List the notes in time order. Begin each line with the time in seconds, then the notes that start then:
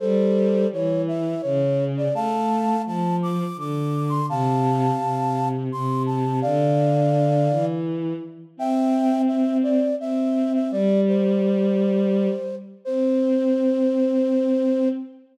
0.00 G3 A4 C5
0.72 E3 C#5
1.08 E5
1.42 C#3 C#5
1.97 D5
2.14 A3 F5 A5
2.86 F3 A5
3.22 D6
3.56 D3 D6
4.09 C6
4.29 C3 F5 A5
4.99 C3
5.72 C3 C6
6.06 A5
6.42 D3 D5 F5
7.50 E3
8.57 C4 E5 G5
9.27 E5
9.63 D5
9.99 C4 E5
10.54 E5
10.71 G3 D5
11.08 C5
12.85 C4 C5